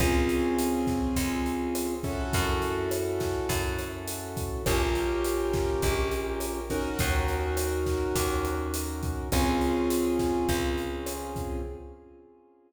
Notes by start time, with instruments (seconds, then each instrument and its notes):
0.00 electric bass (finger) C#2, acoustic grand piano C4 C#4 F4 G#4, kick, cross-stick, closed hi-hat
0.29 closed hi-hat
0.58 closed hi-hat
0.87 kick, snare, closed hi-hat
1.16 electric bass (finger) C#2, kick, closed hi-hat
1.46 closed hi-hat
1.75 cross-stick, closed hi-hat
2.03 acoustic grand piano C#4 E4 F#4 A4, kick, closed hi-hat
2.33 electric bass (finger) F#2, kick, closed hi-hat
2.62 closed hi-hat
2.91 cross-stick, closed hi-hat
3.20 kick, snare, closed hi-hat
3.49 electric bass (finger) F#2, kick, closed hi-hat
3.79 cross-stick, closed hi-hat
4.08 closed hi-hat
4.37 kick, closed hi-hat
4.66 electric bass (finger) A#1, acoustic grand piano C#4 F4 G4 A#4, kick, cross-stick, closed hi-hat
4.95 closed hi-hat
5.24 closed hi-hat
5.53 kick, snare, closed hi-hat
5.82 electric bass (finger) A#1, kick, closed hi-hat
6.11 closed hi-hat
6.40 cross-stick, closed hi-hat
6.70 acoustic grand piano C#4 D#4 F#4 A#4, kick, closed hi-hat
6.99 electric bass (finger) D#2, kick, closed hi-hat
7.28 closed hi-hat
7.57 cross-stick, closed hi-hat
7.86 kick, snare, closed hi-hat
8.15 electric bass (finger) D#2, kick, closed hi-hat
8.45 cross-stick, closed hi-hat
8.74 closed hi-hat
9.03 kick, closed hi-hat
9.32 electric bass (finger) C#2, acoustic grand piano C4 C#4 F4 G#4, kick, cross-stick, closed hi-hat
9.61 closed hi-hat
9.90 closed hi-hat
10.19 kick, snare, closed hi-hat
10.49 electric bass (finger) C#2, kick, closed hi-hat
10.78 closed hi-hat
11.06 cross-stick, closed hi-hat
11.36 kick, closed hi-hat